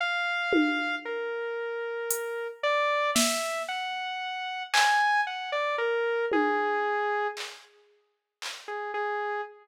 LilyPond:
<<
  \new Staff \with { instrumentName = "Lead 2 (sawtooth)" } { \time 9/8 \tempo 4. = 38 f''4 bes'4. d''8 e''8 ges''4 | aes''8 ges''16 d''16 bes'8 aes'4 r4 r16 aes'16 aes'8 | }
  \new DrumStaff \with { instrumentName = "Drums" } \drummode { \time 9/8 r8 tommh4 r8 hh4 sn4. | hc4. tommh4 hc8 r8 hc4 | }
>>